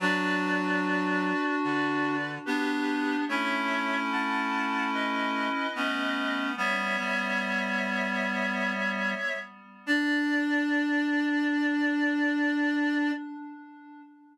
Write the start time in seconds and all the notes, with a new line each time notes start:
0.00 F#3 D4 F#4 B4 D5
1.64 D3 B4 D5
2.46 B3 D4 G4 B4
3.28 A3 C#4 E4 C#5 E5
4.12 F#5 A5
4.93 B4 D#5
5.75 A3 B3 C#4
6.57 G3 B3 C#5 E5
6.98 G3 B3
9.86 D4 D5